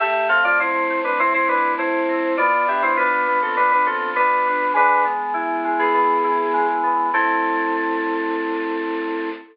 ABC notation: X:1
M:4/4
L:1/16
Q:1/4=101
K:Am
V:1 name="Electric Piano 2"
[Ge]2 [Af] [Fd] [Ec]3 [DB] [Ec] [Ec] [DB]2 [Ec]4 | [Fd]2 [Ge] [Ec] [DB]3 [CA] [DB] [DB] [CA]2 [DB]4 | [DB]2 z5 [B,^G]7 z2 | A16 |]
V:2 name="Electric Piano 2"
A,2 C2 z2 A,2 C2 E2 A,2 C2 | B,2 D2 F2 B,2 z2 F2 B,2 D2 | ^G,2 B,2 E2 G,2 B,2 E2 G,2 B,2 | [A,CE]16 |]